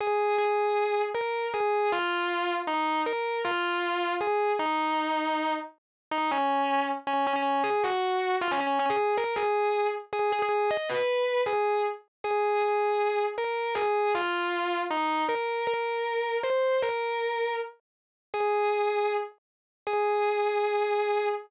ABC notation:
X:1
M:4/4
L:1/16
Q:1/4=157
K:Ab
V:1 name="Distortion Guitar"
A4 A8 B4 | A4 F8 E4 | B4 F8 A4 | E10 z6 |
[K:G#m] D2 C6 z2 C2 C C3 | G2 F6 ^E C C2 C G3 | A2 G6 z2 G2 G G3 | d2 B6 G4 z4 |
[K:Ab] A4 A8 B4 | A4 F8 E4 | B4 B8 c4 | B8 z8 |
[K:G#m] G10 z6 | G16 |]